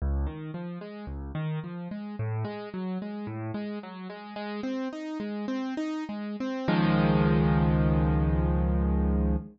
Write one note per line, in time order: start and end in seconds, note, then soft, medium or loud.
0.02 0.26 C#2 medium
0.26 0.51 D#3 medium
0.54 0.79 F3 medium
0.81 1.06 G#3 medium
1.07 1.32 C#2 medium
1.35 1.59 D#3 medium
1.64 1.88 F3 medium
1.91 2.16 G#3 medium
2.19 2.44 A2 medium
2.45 2.69 G#3 medium
2.74 2.98 F#3 medium
3.02 3.26 G#3 medium
3.27 3.51 A2 medium
3.54 3.79 G#3 medium
3.83 4.08 F#3 medium
4.10 4.34 G#3 medium
4.36 4.61 G#3 medium
4.63 4.88 C4 medium
4.93 5.18 D#4 medium
5.20 5.46 G#3 medium
5.48 5.74 C4 medium
5.77 6.04 D#4 medium
6.09 6.36 G#3 medium
6.40 6.68 C4 medium
6.68 9.36 C#2 loud
6.68 9.36 D#3 loud
6.68 9.36 F3 loud
6.68 9.36 G#3 loud